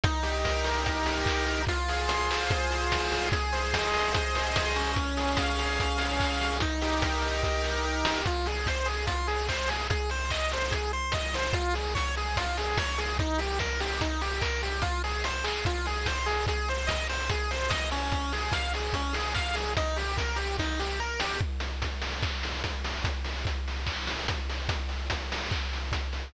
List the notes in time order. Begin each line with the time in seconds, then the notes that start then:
0.04 D#4, kick, closed hi-hat
0.23 G4, open hi-hat
0.44 A#4, kick, snare
0.64 G4, open hi-hat
0.84 D#4, kick, closed hi-hat
1.06 G4, open hi-hat
1.26 A#4, kick, clap
1.46 G4, open hi-hat
1.67 F4, kick, closed hi-hat
1.88 G#4, open hi-hat
2.08 C5, closed hi-hat
2.31 G#4, clap
2.51 F4, kick, closed hi-hat
2.71 G#4, open hi-hat
2.89 C5, kick, snare
3.12 G#4, open hi-hat
3.32 G#4, kick, closed hi-hat
3.52 C5, open hi-hat
3.73 D#5, kick, snare
3.93 C5, open hi-hat
4.14 G#4, kick, closed hi-hat
4.35 C5, open hi-hat
4.56 D#5, kick, snare
4.76 C#4, open hi-hat
4.96 kick, closed hi-hat
5.17 G#4, open hi-hat
5.37 F5, kick, snare
5.59 G#4, open hi-hat
5.79 C#4, kick, closed hi-hat
5.98 G#4, open hi-hat
6.19 F5, kick, clap
6.41 G#4, open hi-hat
6.60 D#4, kick, closed hi-hat
6.82 G4, open hi-hat
7.02 A#4, kick, snare
7.22 G4, open hi-hat
7.43 D#4, kick, snare
7.63 G4, snare
7.84 A#4
8.05 G4, snare
8.26 F4, kick, closed hi-hat
8.46 G#4, open hi-hat
8.66 C5, kick, snare
8.86 G#4, open hi-hat
9.07 F4, kick, closed hi-hat
9.27 G#4, open hi-hat
9.49 C5, kick, clap
9.68 G#4, open hi-hat
9.90 G#4, kick, closed hi-hat
10.09 C5, open hi-hat
10.30 D#5, kick, clap
10.52 C5, open hi-hat
10.71 G#4, kick, closed hi-hat
10.93 C5
11.12 D#5, kick, snare
11.34 C5, open hi-hat
11.53 F4, kick, closed hi-hat
11.73 G#4, open hi-hat
11.95 C#5, kick, snare
12.16 G#4, open hi-hat
12.36 F4, kick, closed hi-hat
12.57 G#4, open hi-hat
12.77 C#5, kick, snare
12.98 G#4, open hi-hat
13.19 D#4, kick, closed hi-hat
13.38 G4, open hi-hat
13.59 A#4, kick, snare
13.80 G4, open hi-hat
14.01 D#4, kick, closed hi-hat
14.21 G4, open hi-hat
14.41 A#4, kick, clap
14.63 G4, open hi-hat
14.82 F4, kick, closed hi-hat
15.04 G#4, open hi-hat
15.24 C5, closed hi-hat
15.44 G#4, clap
15.65 F4, kick, closed hi-hat
15.86 G#4, open hi-hat
16.06 C5, kick, snare
16.26 G#4, open hi-hat
16.47 G#4, kick, closed hi-hat
16.68 C5, open hi-hat
16.87 D#5, kick, snare
17.09 C5, open hi-hat
17.30 G#4, kick, closed hi-hat
17.51 C5, open hi-hat
17.69 D#5, kick, snare
17.91 C#4, open hi-hat
18.12 kick, closed hi-hat
18.32 G#4, open hi-hat
18.52 F5, kick, snare
18.74 G#4, open hi-hat
18.93 C#4, kick, closed hi-hat
19.13 G#4, open hi-hat
19.35 F5, kick, clap
19.54 G#4, open hi-hat
19.77 D#4, kick, closed hi-hat
19.96 G4, open hi-hat
20.17 A#4, kick, snare
20.36 G4, open hi-hat
20.59 D#4, kick, snare
20.79 G4, snare
21.00 A#4
21.20 G4, snare
21.41 kick
21.60 closed hi-hat
21.82 kick, closed hi-hat
22.02 open hi-hat
22.23 kick, clap
22.43 open hi-hat
22.64 kick, closed hi-hat
22.84 open hi-hat
23.04 kick, closed hi-hat
23.24 open hi-hat
23.45 kick, closed hi-hat
23.68 open hi-hat
23.86 kick, clap
24.07 open hi-hat
24.28 kick, closed hi-hat
24.49 open hi-hat
24.69 kick, closed hi-hat
24.89 open hi-hat
25.10 kick, closed hi-hat
25.32 open hi-hat
25.51 kick, clap
25.73 open hi-hat
25.92 kick, closed hi-hat
26.13 open hi-hat